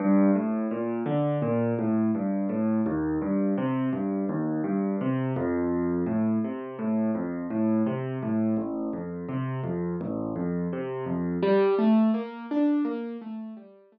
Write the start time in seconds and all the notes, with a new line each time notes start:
0.00 G2
0.35 A2
0.71 A#2
1.06 D3
1.42 A#2
1.79 A2
2.15 G2
2.49 A2
2.86 D#2
3.22 G2
3.58 C3
3.93 G2
4.29 D#2
4.64 G2
5.01 C3
5.36 F2
6.06 A2
6.44 C3
6.79 A2
7.15 F2
7.50 A2
7.86 C3
8.23 A2
8.57 A1
8.93 F2
9.29 C3
9.64 F2
10.01 A1
10.36 F2
10.73 C3
11.06 F2
11.43 G3
11.79 A3
12.14 A#3
12.51 D4
12.85 A#3
13.21 A3
13.57 G3
13.92 A3